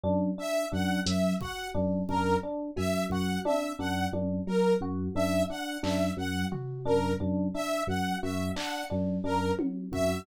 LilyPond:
<<
  \new Staff \with { instrumentName = "Electric Piano 2" } { \clef bass \time 5/4 \tempo 4 = 88 ges,8 r8 ges,8 ges,8 r8 ges,8 ges,8 r8 ges,8 ges,8 | r8 ges,8 ges,8 r8 ges,8 ges,8 r8 ges,8 ges,8 r8 | ges,8 ges,8 r8 ges,8 ges,8 r8 ges,8 ges,8 r8 ges,8 | }
  \new Staff \with { instrumentName = "Electric Piano 1" } { \time 5/4 d'8 d'8 d'8 ges8 ges'8 d'8 d'8 d'8 ges8 ges'8 | d'8 d'8 d'8 ges8 ges'8 d'8 d'8 d'8 ges8 ges'8 | d'8 d'8 d'8 ges8 ges'8 d'8 d'8 d'8 ges8 ges'8 | }
  \new Staff \with { instrumentName = "Lead 2 (sawtooth)" } { \time 5/4 r8 e''8 ges''8 e''8 ges''8 r8 bes'8 r8 e''8 ges''8 | e''8 ges''8 r8 bes'8 r8 e''8 ges''8 e''8 ges''8 r8 | bes'8 r8 e''8 ges''8 e''8 ges''8 r8 bes'8 r8 e''8 | }
  \new DrumStaff \with { instrumentName = "Drums" } \drummode { \time 5/4 r4 r8 hh8 bd4 bd4 cb8 bd8 | tommh4 tommh4 r4 r8 hc8 r8 tomfh8 | r4 r4 r8 hc8 r4 tommh8 bd8 | }
>>